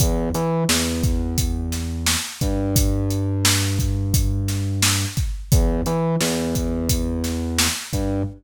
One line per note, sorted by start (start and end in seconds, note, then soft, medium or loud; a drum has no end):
0.00 0.29 E2 loud
0.00 kick loud
0.00 closed hi-hat loud
0.34 0.64 E3 medium
0.34 closed hi-hat medium
0.69 2.15 E2 medium
0.69 snare loud
1.03 kick loud
1.03 closed hi-hat medium
1.38 kick loud
1.38 closed hi-hat loud
1.72 snare medium
1.72 closed hi-hat medium
2.06 snare loud
2.41 5.05 G2 medium
2.41 kick medium
2.41 closed hi-hat medium
2.76 kick loud
2.76 closed hi-hat loud
3.10 closed hi-hat medium
3.45 snare loud
3.79 kick loud
3.79 closed hi-hat medium
4.14 kick loud
4.14 closed hi-hat loud
4.48 snare medium
4.48 closed hi-hat medium
4.82 snare loud
5.17 kick loud
5.17 closed hi-hat medium
5.52 5.81 E2 medium
5.52 kick loud
5.52 closed hi-hat loud
5.86 6.16 E3 medium
5.86 closed hi-hat medium
6.21 7.67 E2 medium
6.21 snare loud
6.55 kick medium
6.55 closed hi-hat medium
6.89 kick medium
6.89 closed hi-hat loud
7.24 snare medium
7.24 closed hi-hat medium
7.58 snare loud
7.93 8.22 G2 medium
7.93 kick medium
7.93 closed hi-hat medium